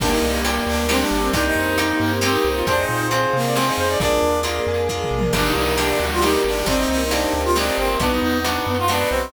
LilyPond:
<<
  \new Staff \with { instrumentName = "Lead 2 (sawtooth)" } { \time 3/4 \key ees \major \tempo 4 = 135 d'16 ees'8. r8 d'8 c'16 d'8. | d'16 ees'8. r8 bes8 c'16 ees'8. | d'16 ees'8. r8 bes8 c'16 ees'8. | d'4 r2 |
d'16 ees'16 ees'8 d'8. f'16 ees'8 d'8 | d'16 ees'16 ees'8 d'8. f'16 d'8 c'8 | d'16 ees'16 ees'8 d'8. f'16 d'8 c'8 | }
  \new Staff \with { instrumentName = "Clarinet" } { \time 3/4 \key ees \major bes2 d'8. c'16 | ees'2 g'8. f'16 | c''8 c''8 c''8. d''16 c''8 c''16 d''16 | d''4 r2 |
d'8 r8 d'8 fis'8 g'4 | c'4 r2 | ces'4 r8 ces'16 r4 r16 | }
  \new Staff \with { instrumentName = "Acoustic Guitar (steel)" } { \time 3/4 \key ees \major <bes d' g'>4 <bes d' g'>4 <bes d' g'>4 | <bes c' ees' g'>4 <bes c' ees' g'>4 <bes c' ees' g'>4 | <c' f' aes'>4 <c' f' aes'>4 <c' f' aes'>4 | <bes d' f' aes'>4 <bes d' f' aes'>4 <bes d' f' aes'>4 |
<bes d' g'>4 <bes d' g'>4 <bes d' g'>4 | <bes c' ees' g'>4 <bes c' ees' g'>4 <bes c' ees' g'>4 | <ces' ees' ges'>4 <ces' ees' ges'>4 <ces' ees' ges'>4 | }
  \new Staff \with { instrumentName = "Tubular Bells" } { \time 3/4 \key ees \major bes'8 d''8 g''8 d''8 bes'8 d''8 | bes'8 c''8 ees''8 g''8 ees''8 c''8 | c''8 f''8 aes''8 f''8 c''8 f''8 | bes'8 d''8 f''8 aes''8 f''8 d''8 |
bes'8 d''8 g''8 d''8 bes'8 d''8 | bes'8 c''8 ees''8 g''8 ees''8 c''8 | ces''8 ees''8 ges''8 ees''8 ces''8 ees''8 | }
  \new Staff \with { instrumentName = "Synth Bass 1" } { \clef bass \time 3/4 \key ees \major g,,8 c,4 d,4 g,,8 | c,8 f,4 g,4 c,8 | f,8 bes,4 c4 f,8 | bes,,8 ees,4 f,4 bes,,8 |
g,,8 c,4 d,4 g,,8 | g,,8 c,4 d,4 g,,8 | ces,8 e,4 ges,4 ces,8 | }
  \new Staff \with { instrumentName = "String Ensemble 1" } { \time 3/4 \key ees \major <bes d' g'>4. <g bes g'>4. | <bes c' ees' g'>4. <bes c' g' bes'>4. | <c' f' aes'>4. <c' aes' c''>4. | <bes d' f' aes'>4. <bes d' aes' bes'>4. |
<bes d' g'>4. <g bes g'>4. | <bes c' ees' g'>4. <bes c' g' bes'>4. | <ces' ees' ges'>4. <ces' ges' ces''>4. | }
  \new DrumStaff \with { instrumentName = "Drums" } \drummode { \time 3/4 \tuplet 3/2 { <cymc bd>8 r8 hh8 hh8 r8 hh8 sn8 r8 hh8 } | \tuplet 3/2 { <hh bd>8 r8 hh8 hh8 r8 hh8 sn8 r8 hh8 } | \tuplet 3/2 { <hh bd>8 r8 hh8 hh8 r8 hh8 sn8 r8 hh8 } | \tuplet 3/2 { <hh bd>8 r8 hh8 hh8 r8 hh8 bd8 toml8 tommh8 } |
\tuplet 3/2 { <cymc bd>8 r8 hh8 hh8 r8 hh8 sn8 r8 hh8 } | \tuplet 3/2 { <hh bd>8 r8 hh8 hh8 r8 hh8 sn8 r8 hh8 } | \tuplet 3/2 { <hh bd>8 r8 hh8 hh8 r8 hh8 sn8 r8 hh8 } | }
>>